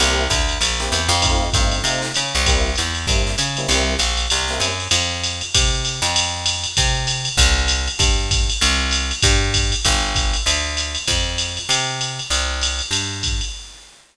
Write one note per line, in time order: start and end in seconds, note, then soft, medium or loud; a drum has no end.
0.00 0.28 C2 medium
0.00 0.23 A#3 loud
0.00 0.23 C4 loud
0.00 0.23 E4 loud
0.00 0.23 G4 loud
0.00 ride medium
0.30 0.58 D2 medium
0.30 kick soft
0.30 hi-hat pedal medium
0.30 ride medium
0.49 ride medium
0.61 0.89 A#1 medium
0.61 ride medium
0.80 1.00 A#3 medium
0.80 1.00 C4 medium
0.80 1.00 E4 medium
0.80 1.00 G4 medium
0.80 snare soft
0.92 1.09 E2 medium
0.92 hi-hat pedal medium
0.92 ride medium
1.09 1.50 F2 medium
1.09 ride medium
1.22 1.45 A3 medium
1.22 1.45 C4 loud
1.22 1.45 D#4 medium
1.22 1.45 F4 loud
1.22 kick medium
1.22 ride medium
1.53 1.82 G2 medium
1.53 1.77 A3 medium
1.53 1.77 C4 medium
1.53 1.77 D#4 medium
1.53 1.77 F4 medium
1.53 kick medium
1.53 hi-hat pedal medium
1.53 ride medium
1.72 ride medium
1.84 2.12 C3 medium
1.84 2.07 A3 medium
1.84 2.07 C4 medium
1.84 2.07 D#4 medium
1.84 2.07 F4 medium
1.84 ride medium
2.02 snare soft
2.14 2.33 C#3 medium
2.14 hi-hat pedal medium
2.14 ride medium
2.35 2.76 C2 medium
2.35 ride medium
2.46 2.70 G3 loud
2.46 2.70 A#3 loud
2.46 2.70 C4 loud
2.46 2.70 E4 medium
2.46 kick soft
2.46 ride medium
2.75 3.06 E2 medium
2.75 hi-hat pedal medium
2.75 ride medium
2.95 ride medium
3.07 3.36 G2 medium
3.07 3.32 G3 medium
3.07 3.32 A#3 medium
3.07 3.32 C4 medium
3.07 3.32 E4 medium
3.07 kick medium
3.07 ride medium
3.27 snare soft
3.38 3.67 C#3 medium
3.38 hi-hat pedal medium
3.38 ride medium
3.57 3.67 G3 medium
3.57 3.67 A#3 medium
3.57 3.67 C4 loud
3.57 3.67 E4 medium
3.57 ride medium
3.68 3.97 C2 medium
3.68 3.94 G3 loud
3.68 3.94 A#3 medium
3.68 3.94 C4 medium
3.68 3.94 E4 loud
3.68 ride medium
3.99 4.27 A#1 medium
3.99 hi-hat pedal medium
3.99 ride medium
4.17 ride medium
4.30 4.59 C2 medium
4.30 ride medium
4.48 4.70 G3 medium
4.48 4.70 A#3 medium
4.48 4.70 C4 medium
4.48 4.70 E4 medium
4.48 snare soft
4.60 4.88 F#2 medium
4.60 hi-hat pedal medium
4.60 ride medium
4.80 ride medium
4.91 5.42 F2 medium
4.91 ride medium
5.24 hi-hat pedal medium
5.24 ride medium
5.41 ride medium
5.54 6.00 C3 medium
5.54 kick medium
5.54 ride loud
5.85 hi-hat pedal medium
5.85 ride medium
6.02 6.66 F2 medium
6.02 ride medium
6.16 ride medium
6.46 hi-hat pedal medium
6.46 ride medium
6.64 ride medium
6.77 7.29 C3 medium
6.77 kick soft
6.77 ride medium
7.07 hi-hat pedal medium
7.07 ride medium
7.25 ride medium
7.37 7.89 C2 medium
7.37 kick medium
7.37 ride medium
7.68 hi-hat pedal medium
7.68 ride medium
7.87 ride medium
7.99 8.50 G2 medium
7.99 kick medium
7.99 ride medium
8.31 kick medium
8.31 hi-hat pedal medium
8.31 ride medium
8.50 ride medium
8.61 9.12 C2 medium
8.61 ride medium
8.91 hi-hat pedal medium
8.91 ride medium
9.11 ride medium
9.22 9.75 G2 medium
9.22 kick medium
9.22 ride medium
9.54 kick soft
9.54 hi-hat pedal medium
9.54 ride medium
9.72 ride medium
9.85 10.36 G1 medium
9.85 kick soft
9.85 ride medium
10.15 kick soft
10.15 hi-hat pedal medium
10.15 ride medium
10.33 ride medium
10.46 10.97 D2 medium
10.46 ride medium
10.77 hi-hat pedal medium
10.77 ride medium
10.95 ride medium
11.07 11.59 F2 medium
11.07 kick soft
11.07 ride medium
11.38 hi-hat pedal medium
11.38 ride medium
11.57 ride medium
11.69 12.20 C3 medium
11.69 ride medium
12.01 hi-hat pedal medium
12.01 ride medium
12.19 ride medium
12.30 12.81 C2 medium
12.30 ride medium
12.61 hi-hat pedal medium
12.61 ride medium
12.79 ride medium
12.91 13.42 G2 medium
12.91 ride medium
13.23 kick soft
13.23 hi-hat pedal medium
13.23 ride medium
13.41 ride medium